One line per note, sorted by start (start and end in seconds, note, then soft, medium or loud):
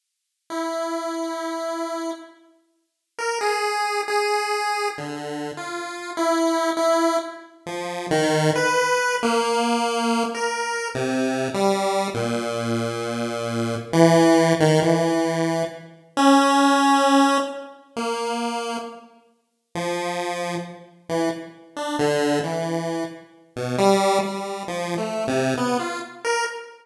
0.50 2.11 E4 soft
3.18 3.39 A#4 medium
3.41 4.01 G#4 medium
4.08 4.88 G#4 medium
4.98 5.51 D3 soft
5.57 6.11 F4 medium
6.17 6.71 E4 medium
6.77 7.17 E4 medium
7.66 8.07 F3 medium
8.11 8.51 D#3 loud
8.56 9.16 B4 medium
9.23 10.23 A#3 loud
10.35 10.88 A#4 medium
10.95 11.48 C3 medium
11.54 12.08 G3 medium
12.14 13.75 A#2 medium
13.93 14.53 E3 loud
14.60 14.80 D#3 loud
14.82 15.63 E3 medium
16.17 17.38 C#4 loud
17.96 18.77 A#3 medium
19.75 20.56 F3 medium
21.09 21.29 E3 medium
21.76 21.97 D4 medium
21.99 22.39 D3 loud
22.44 23.04 E3 medium
23.56 23.76 B2 medium
23.78 24.18 G3 loud
24.23 24.63 G3 medium
24.68 24.95 F3 medium
24.98 25.24 A3 medium
25.27 25.54 C3 loud
25.57 25.78 B3 medium
25.79 25.99 F4 medium
26.25 26.45 A#4 medium